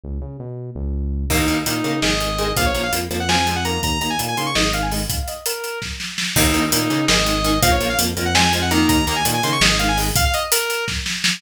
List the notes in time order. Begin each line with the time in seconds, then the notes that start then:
0.04 C#2
0.22 C#3
0.40 B2
0.75 C#2
1.30 D#2 D#3 A#3 D#4, kick, crash
1.48 D#2 D#3 A#3, closed hi-hat
1.66 A#2 D#3 A#3 D#4, closed hi-hat
1.84 C#3 D#3 A#3, closed hi-hat
2.02 G#1 D#3 G#3 D#5, snare
2.20 D#3 G#3, closed hi-hat
2.38 D#3 G#3, closed hi-hat
2.56 A#1 F3 A#3 F5, kick, closed hi-hat
2.66 C#5
2.75 A#1 F3 A#3, closed hi-hat
2.83 F5
2.92 F2 F3 A#3, closed hi-hat
3.10 F2 F3 A#3, closed hi-hat
3.20 F#5
3.29 F3 G#3 C4 G#5, snare
3.47 F3 G#3 C4 G#5, closed hi-hat
3.56 F#5
3.65 D#3 A#3 A#5, closed hi-hat
3.83 D#2 A#5, kick, closed hi-hat
4.01 D#2 D#3 A#3 A#5, closed hi-hat
4.10 G#5
4.19 A#2 D#3 A#3, closed hi-hat
4.28 G#5
4.37 C#3 D#3 A#3 C6, closed hi-hat
4.46 C#6
4.55 G#1 D#3 G#3 D#5, snare
4.73 D#3 G#3 F5, closed hi-hat
4.83 G#5
4.91 D#3 G#3, open hi-hat
5.09 F5, kick, closed hi-hat
5.19 F5
5.28 D#5, closed hi-hat
5.46 A#4, closed hi-hat
5.64 closed hi-hat
5.82 kick, snare
6.00 snare
6.18 snare
6.36 D#2 D#3 A#3 D#4, kick, crash
6.54 D#2 D#3 A#3, closed hi-hat
6.72 A#2 D#3 A#3 D#4, closed hi-hat
6.90 C#3 D#3 A#3, closed hi-hat
7.08 G#1 D#3 G#3 D#5, snare
7.26 D#3 G#3, closed hi-hat
7.44 D#3 G#3, closed hi-hat
7.62 A#1 F3 A#3 F5, kick, closed hi-hat
7.72 C#5
7.80 A#1 F3 A#3, closed hi-hat
7.90 F5
7.98 F2 F3 A#3, closed hi-hat
8.17 F2 F3 A#3, closed hi-hat
8.25 F#5
8.35 F3 G#3 C4 G#5, snare
8.53 F3 G#3 C4 G#5, closed hi-hat
8.62 F#5
8.71 D#3 A#3 A#5, closed hi-hat
8.89 D#2 A#5, kick, closed hi-hat
9.07 D#2 D#3 A#3 A#5, closed hi-hat
9.16 G#5
9.25 A#2 D#3 A#3, closed hi-hat
9.34 G#5
9.43 C#3 D#3 A#3 C6, closed hi-hat
9.52 C#6
9.61 G#1 D#3 G#3 D#5, snare
9.79 D#3 G#3 F5, closed hi-hat
9.88 G#5
9.97 D#3 G#3, open hi-hat
10.16 F5, kick, closed hi-hat
10.25 F5
10.34 D#5, closed hi-hat
10.52 A#4, closed hi-hat
10.70 closed hi-hat
10.88 kick, snare
11.06 snare
11.24 snare